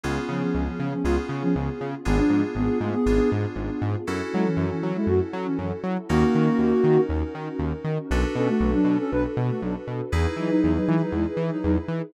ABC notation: X:1
M:4/4
L:1/16
Q:1/4=119
K:F#m
V:1 name="Ocarina"
z2 [^E,C] [E,C]2 [E,C]2 [E,C] [G,^E] z2 [E,C] [E,C] z3 | [B,G] [=F,D]2 z [B,G]2 [A,=F] [B,G]3 z6 | z2 [G,E] [E,C]2 [E,C]2 [G,E] [A,F] z2 [E,C] [E,C] z3 | [^A,F]8 z8 |
z2 [CA] [A,F]2 [F,D]2 [CA] [DB] z2 [A,F] [F,D] z3 | z2 [F,^D] [F,D]2 [F,D]2 [F,D] [G,E] z2 [F,D] [F,D] z3 |]
V:2 name="Electric Piano 2"
[B,C^EG]8 [B,CEG]8 | [B,D=FG]8 [B,DFG]8 | [CEFA]16 | [C^DF^A]16 |
[DFAB]16 | [^DEGB]16 |]
V:3 name="Synth Bass 1" clef=bass
C,,2 C,2 C,,2 C,2 C,,2 C,2 C,,2 C,2 | G,,,2 G,,2 G,,,2 G,,2 G,,,2 G,,2 G,,,2 G,,2 | F,,2 F,2 F,,2 F,2 F,,2 F,2 F,,2 F,2 | ^D,,2 ^D,2 D,,2 D,2 D,,2 D,2 D,,2 D,2 |
B,,,2 B,,2 B,,,2 B,,2 B,,,2 B,,2 B,,,2 B,,2 | E,,2 E,2 E,,2 E,2 E,,2 E,2 E,,2 E,2 |]
V:4 name="Pad 2 (warm)"
[B,C^EG]16 | [B,D=FG]16 | [CEFA]16 | [C^DF^A]16 |
[DFAB]16 | [^DEGB]16 |]